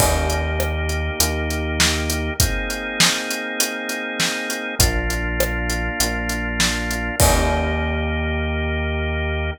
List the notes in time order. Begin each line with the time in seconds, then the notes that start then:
0.00 D#2 A#3 D#4 G4, kick, crash
0.30 closed hi-hat
0.60 cross-stick
0.89 closed hi-hat
1.20 D#2, closed hi-hat
1.50 closed hi-hat
1.80 snare
2.10 closed hi-hat
2.40 A#3 C4 D#4 G#4, kick, closed hi-hat
2.70 closed hi-hat
3.00 snare
3.31 closed hi-hat
3.60 closed hi-hat
3.89 closed hi-hat
4.20 snare
4.50 closed hi-hat
4.79 A#1 A#3 D4 F4, kick, closed hi-hat
5.10 closed hi-hat
5.40 cross-stick
5.70 closed hi-hat
6.00 A#1, closed hi-hat
6.29 closed hi-hat
6.60 snare
6.91 closed hi-hat
7.20 D#2 A#3 D#4 G4, kick, crash